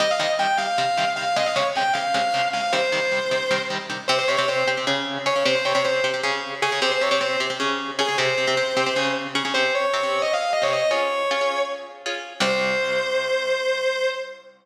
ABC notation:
X:1
M:7/8
L:1/16
Q:1/4=154
K:Cphr
V:1 name="Distortion Guitar"
e f e z g2 f6 f2 | e f d z g2 f6 f2 | c10 z4 | c c d d c2 z6 d2 |
c c d d c2 z6 A2 | c c d d c2 z6 A2 | c10 z4 | c2 d5 e f2 e d e2 |
"^rit." d8 z6 | c14 |]
V:2 name="Overdriven Guitar"
[C,E,G,]2 [C,E,G,]2 [C,E,G,]2 [C,E,G,]2 [C,E,G,]2 [C,E,G,]2 [C,E,G,]2 | [C,D,A,]2 [C,D,A,]2 [C,D,A,]2 [C,D,A,]2 [C,D,A,]2 [C,D,A,]2 [C,D,A,]2 | [C,E,G,]2 [C,E,G,]2 [C,E,G,]2 [C,E,G,]2 [C,E,G,]2 [C,E,G,]2 [C,E,G,]2 | [C,CG]2 [C,CG] [C,CG] [C,CG]2 [C,CG] [C,CG] [D,DA]4 [D,DA] [D,DA] |
[C,CG]2 [C,CG] [C,CG] [C,CG]2 [C,CG] [C,CG] [D,DA]4 [D,DA] [D,DA] | [C,CG]2 [C,CG] [C,CG] [C,CG]2 [C,CG] [C,CG] [D,DA]4 [D,DA] [D,DA] | [C,CG]2 [C,CG] [C,CG] [C,CG]2 [C,CG] [C,CG] [D,DA]4 [D,DA] [D,DA] | [C,CG]4 [C,CG] [C,CG]6 [C,CG]3 |
"^rit." [DFA]4 [DFA] [DFA]6 [DFA]3 | [C,,C,G,]14 |]